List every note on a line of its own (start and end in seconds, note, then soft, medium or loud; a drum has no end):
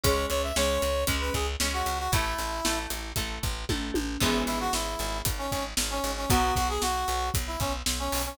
0.04 0.26 C#2 medium
0.04 0.51 G#3 loud
0.04 0.51 C#4 loud
0.04 0.26 C#5 medium
0.04 kick loud
0.04 closed hi-hat loud
0.30 0.52 C#2 medium
0.30 0.42 C#5 medium
0.30 closed hi-hat medium
0.43 0.56 E5 medium
0.56 0.78 C#2 medium
0.56 1.03 G#3 medium
0.56 1.03 C#4 medium
0.56 1.04 C#5 medium
0.56 snare loud
0.82 1.05 C#2 medium
0.82 closed hi-hat medium
1.07 1.30 C#2 loud
1.07 1.54 G#3 medium
1.07 1.54 C#4 medium
1.07 kick loud
1.07 closed hi-hat loud
1.21 1.33 B4 medium
1.34 1.56 C#2 loud
1.34 1.47 G#4 medium
1.34 kick medium
1.34 closed hi-hat medium
1.60 1.82 C#2 medium
1.60 2.08 G#3 medium
1.60 2.08 C#4 medium
1.60 snare loud
1.73 1.98 F#4 medium
1.86 2.08 C#2 medium
1.86 closed hi-hat medium
1.99 2.11 F#4 medium
2.12 2.34 A1 medium
2.12 2.60 A3 loud
2.12 2.79 E4 medium
2.12 2.60 E4 loud
2.12 kick loud
2.12 closed hi-hat loud
2.39 2.61 A1 medium
2.39 closed hi-hat medium
2.65 2.87 A1 medium
2.65 3.12 A3 medium
2.65 3.12 E4 medium
2.65 snare loud
2.90 3.13 A1 medium
2.90 closed hi-hat loud
3.16 3.39 A1 medium
3.16 3.63 A3 medium
3.16 3.63 E4 medium
3.16 kick loud
3.16 closed hi-hat loud
3.43 3.65 A1 medium
3.43 kick loud
3.43 closed hi-hat medium
3.69 3.91 A1 medium
3.69 4.16 A3 loud
3.69 4.16 E4 medium
3.69 kick loud
3.69 high tom loud
3.94 4.17 A1 medium
3.94 high tom loud
4.20 4.44 G#1 medium
4.20 6.09 E3 loud
4.20 6.09 G#3 loud
4.20 6.09 B3 loud
4.20 4.43 E4 medium
4.20 kick loud
4.20 crash loud
4.47 4.69 G#1 medium
4.47 4.59 E4 medium
4.47 closed hi-hat medium
4.60 4.72 F#4 medium
4.73 4.96 G#1 medium
4.73 5.18 E4 medium
4.73 snare loud
4.99 5.22 G#1 loud
4.99 closed hi-hat medium
5.25 5.48 G#1 medium
5.25 kick loud
5.25 closed hi-hat loud
5.38 5.51 C#4 medium
5.51 5.74 G#1 medium
5.51 5.64 C#4 medium
5.51 kick medium
5.51 closed hi-hat medium
5.77 6.00 G#1 medium
5.77 snare loud
5.91 6.12 C#4 medium
6.04 6.26 G#1 medium
6.04 closed hi-hat medium
6.17 6.29 C#4 medium
6.30 6.52 B1 loud
6.30 8.18 F#3 loud
6.30 8.18 B3 loud
6.30 6.54 F#4 medium
6.30 kick loud
6.30 closed hi-hat loud
6.56 6.78 B1 medium
6.56 6.68 F#4 medium
6.56 kick loud
6.56 closed hi-hat medium
6.69 6.81 G#4 medium
6.82 7.04 B1 medium
6.82 7.29 F#4 medium
6.82 snare loud
7.08 7.31 B1 loud
7.08 closed hi-hat medium
7.34 7.57 B1 medium
7.34 kick loud
7.34 closed hi-hat loud
7.47 7.59 E4 medium
7.60 7.82 B1 medium
7.60 7.73 C#4 medium
7.60 kick loud
7.60 closed hi-hat medium
7.86 8.09 B1 medium
7.86 snare loud
7.99 8.22 C#4 medium
8.12 8.34 B1 medium
8.12 open hi-hat loud
8.26 8.37 C#4 medium